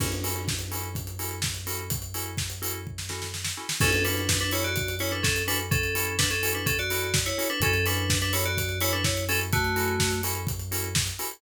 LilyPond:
<<
  \new Staff \with { instrumentName = "Electric Piano 2" } { \time 4/4 \key fis \minor \tempo 4 = 126 r1 | r1 | <cis' a'>8 <d' b'>8. <d' b'>16 <e' cis''>16 <fis' d''>8. <e' cis''>16 <d' b'>16 <cis' a'>8 <d' b'>16 r16 | <cis' a'>4 <d' b'>16 <cis' a'>8 <d' b'>16 <cis' a'>16 <fis' d''>4 <e' cis''>8 <d' b'>16 |
<cis' a'>8 <d' b'>8. <d' b'>16 <e' cis''>16 <fis' d''>8. <e' cis''>16 <d' b'>16 <e' cis''>8 <cis' a'>16 r16 | <a fis'>4. r2 r8 | }
  \new Staff \with { instrumentName = "Electric Piano 2" } { \time 4/4 \key fis \minor <cis' e' fis' a'>8 <cis' e' fis' a'>4 <cis' e' fis' a'>4 <cis' e' fis' a'>4 <cis' e' fis' a'>8~ | <cis' e' fis' a'>8 <cis' e' fis' a'>4 <cis' e' fis' a'>4 <cis' e' fis' a'>4 <cis' e' fis' a'>8 | <cis' e' fis' a'>8 <cis' e' fis' a'>4 <cis' e' fis' a'>4 <cis' e' fis' a'>4 <cis' e' fis' a'>8~ | <cis' e' fis' a'>8 <cis' e' fis' a'>4 <cis' e' fis' a'>4 <cis' e' fis' a'>4 <cis' e' fis' a'>8 |
<cis' e' fis' a'>8 <cis' e' fis' a'>4 <cis' e' fis' a'>4 <cis' e' fis' a'>4 <cis' e' fis' a'>8~ | <cis' e' fis' a'>8 <cis' e' fis' a'>4 <cis' e' fis' a'>4 <cis' e' fis' a'>4 <cis' e' fis' a'>8 | }
  \new Staff \with { instrumentName = "Synth Bass 2" } { \clef bass \time 4/4 \key fis \minor fis,1~ | fis,1 | fis,1~ | fis,1 |
fis,1~ | fis,1 | }
  \new DrumStaff \with { instrumentName = "Drums" } \drummode { \time 4/4 <cymc bd>16 hh16 hho16 hh16 <bd sn>16 hh16 hho16 hh16 <hh bd>16 hh16 hho16 hh16 <bd sn>16 hh16 hho16 hh16 | <hh bd>16 hh16 hho16 hh16 <bd sn>16 hh16 hho16 hh16 bd16 sn16 sn16 sn16 sn16 sn8 sn16 | <cymc bd>16 hh16 hho16 hh16 <bd sn>16 hh16 hho16 hh16 <hh bd>16 hh16 hho16 hh16 <bd sn>16 hh16 hho16 hh16 | <hh bd>16 hh16 hho16 hh16 <bd sn>16 hh16 hho16 hh16 <hh bd>16 hh16 hho16 hh16 <bd sn>16 hh16 hho16 hh16 |
<hh bd>16 hh16 hho16 hh16 <bd sn>16 hh16 hho16 hh16 <hh bd>16 hh16 hho16 hh16 <bd sn>16 hh16 hho16 hh16 | <hh bd>16 hh16 hho16 hh16 <bd sn>16 hh16 hho16 hh16 <hh bd>16 hh16 hho16 hh16 <bd sn>16 hh16 hho16 hh16 | }
>>